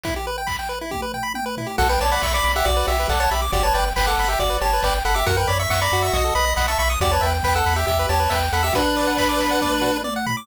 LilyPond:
<<
  \new Staff \with { instrumentName = "Lead 1 (square)" } { \time 4/4 \key b \minor \tempo 4 = 138 r1 | <a' fis''>16 <b' g''>16 <cis'' a''>16 <d'' b''>16 <e'' cis'''>16 <d'' b''>8 <g' e''>16 <fis' d''>8 <g' e''>8 <a' fis''>16 <cis'' a''>16 <g' e''>16 r16 | <fis' d''>16 <cis'' a''>16 <b' g''>16 r16 <b' g''>16 <a' fis''>8 <g' e''>16 <fis' d''>8 <cis'' a''>8 <b' g''>16 r16 <a' fis''>16 <g' e''>16 | <ais' fis''>16 <b' g''>16 <d'' b''>16 <e'' cis'''>16 <e'' cis'''>16 <d'' b''>8 <e'' cis'''>16 <fis' dis''>8 <dis'' b''>8 <dis'' b''>16 <e'' cis'''>16 <e'' cis'''>16 r16 |
<fis' d''>16 <cis'' a''>16 <b' g''>16 r16 <b' g''>16 <a' fis''>8 <g' e''>16 <g' e''>8 <cis'' a''>8 <b' g''>16 r16 <a' fis''>16 <g' e''>16 | <d' b'>2. r4 | }
  \new Staff \with { instrumentName = "Lead 1 (square)" } { \time 4/4 \key b \minor e'16 g'16 b'16 g''16 b''16 g''16 b'16 e'16 g'16 b'16 g''16 b''16 g''16 b'16 e'16 g'16 | fis'16 b'16 d''16 fis''16 b''16 d'''16 b''16 fis''16 d''16 b'16 fis'16 b'16 d''16 fis''16 b''16 d'''16 | g'16 b'16 d''16 g''16 b''16 d'''16 b''16 g''16 d''16 b'16 g'16 b'16 d''16 g''16 b''16 d'''16 | fis'16 ais'16 cis''16 e''16 fis''16 ais''16 fis'8. a'16 b'16 dis''16 fis''16 a''16 b''16 dis'''16 |
g'16 b'16 e''16 g''16 b''16 e'''16 b''16 g''16 e''16 b'16 g'16 b'16 e''16 g''16 b''16 e'''16 | fis'16 b'16 d''16 fis''16 b''16 d'''16 b''16 fis''16 d''16 b'16 fis'16 b'16 d''16 fis''16 b''16 d'''16 | }
  \new Staff \with { instrumentName = "Synth Bass 1" } { \clef bass \time 4/4 \key b \minor r1 | b,,8 b,,8 b,,8 b,,8 b,,8 b,,8 b,,8 b,,8 | g,,8 g,,8 g,,8 g,,8 g,,8 g,,8 g,,8 g,,8 | fis,8 fis,8 fis,8 fis,8 b,,8 b,,8 b,,8 b,,8 |
e,8 e,8 e,8 e,8 e,8 e,8 e,8 e,8 | r1 | }
  \new DrumStaff \with { instrumentName = "Drums" } \drummode { \time 4/4 <hh bd>4 <hc bd>4 <bd tommh>8 tomfh8 tommh8 tomfh8 | <cymc bd>8 hho8 <bd sn>8 hho8 <hh bd>8 hho8 <hc bd>8 hho8 | <hh bd>8 hho8 <bd sn>8 hho8 <hh bd>8 hho8 <hc bd>8 hho8 | <hh bd>8 hho8 <bd sn>8 hho8 <hh bd>8 hho8 <bd sn>8 hho8 |
<hh bd>8 hho8 <hc bd>8 hho8 <hh bd>8 hho8 <bd sn>8 hho8 | <hh bd>8 hho8 <hc bd>8 hho8 <bd tommh>8 tomfh8 tommh8 tomfh8 | }
>>